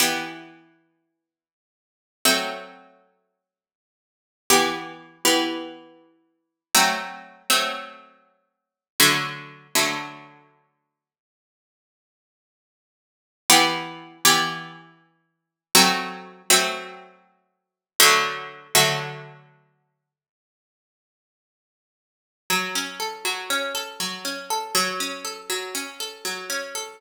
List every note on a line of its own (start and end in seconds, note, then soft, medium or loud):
0.00 2.02 E3 medium
0.00 2.02 B3 medium
0.00 2.02 G4 medium
2.25 4.28 F#3 medium
2.25 4.28 A3 loud
2.25 4.28 C4 medium
4.50 5.18 E3 medium
4.50 5.18 B3 loud
4.50 5.18 G4 loud
5.25 6.60 E3 loud
5.25 6.60 B3 medium
5.25 6.60 G4 medium
6.75 7.42 F#3 loud
6.75 7.42 A3 loud
6.75 7.42 C4 loud
7.50 8.85 F#3 medium
7.50 8.85 A3 medium
7.50 8.85 C4 medium
9.00 9.67 D3 loud
9.00 9.67 F#3 loud
9.00 9.67 A3 medium
9.75 11.10 D3 medium
9.75 11.10 F#3 medium
9.75 11.10 A3 medium
13.50 14.17 E3 loud
13.50 14.17 B3 loud
13.50 14.17 G4 loud
14.25 15.60 E3 loud
14.25 15.60 B3 medium
14.25 15.60 G4 loud
15.75 16.42 F#3 loud
15.75 16.42 A3 loud
15.75 16.42 C4 loud
16.50 17.85 F#3 loud
16.50 17.85 A3 loud
16.50 17.85 C4 medium
18.00 18.67 D3 loud
18.00 18.67 F#3 loud
18.00 18.67 A3 loud
18.75 20.10 D3 loud
18.75 20.10 F#3 loud
18.75 20.10 A3 medium
22.50 23.24 F#3 medium
22.75 23.50 C#4 medium
23.00 23.74 A4 medium
23.25 23.99 F#3 medium
23.50 24.24 C#4 medium
23.75 24.50 A4 medium
24.00 24.71 F#3 medium
24.25 24.72 C#4 medium
24.50 24.74 A4 medium
24.75 25.49 F#3 loud
25.00 25.74 C#4 medium
25.25 26.00 A4 medium
25.50 26.24 F#3 medium
25.75 26.49 C#4 medium
26.00 26.74 A4 medium
26.25 26.96 F#3 medium
26.50 26.97 C#4 medium
26.75 26.99 A4 medium